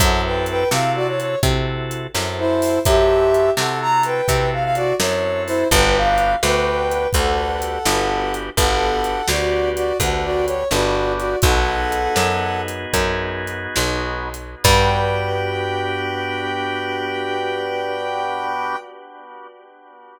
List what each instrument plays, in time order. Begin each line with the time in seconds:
0.00 electric bass (finger) F#2, drawbar organ C4 E4 F#4 A4, brass section A4 F#5, kick, closed hi-hat
0.25 brass section B4 G5
0.46 brass section B4 G5, closed hi-hat
0.71 electric bass (finger) C3, drawbar organ C4 E4 F#4 A4, brass section F5, snare
0.96 brass section F#4 D5
1.08 brass section C#5
1.20 brass section C#5, closed hi-hat
1.43 electric bass (finger) C3, drawbar organ C4 E4 F#4 A4, kick, closed hi-hat
1.91 closed hi-hat
2.14 electric bass (finger) F#2, drawbar organ C4 E4 F#4 A4, snare
2.39 brass section E4 C5
2.62 open hi-hat
2.85 electric bass (finger) F#2, drawbar organ C4 E4 F#4 A4, brass section G4 E5, kick, closed hi-hat
3.34 closed hi-hat
3.57 electric bass (finger) C3, drawbar organ C4 E4 F#4 A4, brass section A4 F#5, snare
3.81 brass section A#5
4.03 brass section B4 G5, closed hi-hat
4.28 electric bass (finger) C3, drawbar organ C4 E4 F#4 A4, kick, closed hi-hat
4.53 brass section F5
4.64 brass section F5
4.75 brass section F#4 D5, closed hi-hat
4.99 electric bass (finger) F#2, drawbar organ C4 E4 F#4 A4, brass section C#5, snare
5.46 brass section E4 C5, open hi-hat
5.71 electric bass (finger) G1, drawbar organ B3 D4 F#4 G4, brass section B4 G5, kick, closed hi-hat
5.96 brass section F5
6.18 closed hi-hat
6.43 electric bass (finger) D2, drawbar organ B3 D4 F#4 G4, brass section B4 G5, snare
6.91 closed hi-hat
7.13 electric bass (finger) D2, drawbar organ B3 D4 F#4 G4, brass section A4 F#5, kick, closed hi-hat
7.62 closed hi-hat
7.86 electric bass (finger) G1, drawbar organ B3 D4 F#4 G4, snare
8.34 closed hi-hat
8.57 electric bass (finger) G1, drawbar organ B3 D4 F#4 G4, brass section A4 F#5, kick, closed hi-hat
9.04 closed hi-hat
9.28 electric bass (finger) D2, drawbar organ B3 D4 F#4 G4, brass section F#4 D5, snare
9.76 brass section F#4 D5, closed hi-hat
10.00 electric bass (finger) D2, drawbar organ B3 D4 F#4 G4, brass section A4 F#5, kick, closed hi-hat
10.24 brass section F#4 D5
10.46 brass section C#5, closed hi-hat
10.71 electric bass (finger) G1, drawbar organ B3 D4 F#4 G4, brass section F#4 D5, snare
11.18 brass section F#4 D5, closed hi-hat
11.42 electric bass (finger) B1, drawbar organ B3 D#4 F#4 G#4, brass section A4 F#5, kick, closed hi-hat
11.92 closed hi-hat
12.16 electric bass (finger) F#2, snare
12.68 closed hi-hat
12.93 electric bass (finger) F#2, kick, closed hi-hat
13.47 closed hi-hat
13.76 electric bass (finger) B1, snare
14.34 closed hi-hat
14.64 electric bass (finger) G2, drawbar organ B3 D4 F#4 G4, brass section G5, kick, crash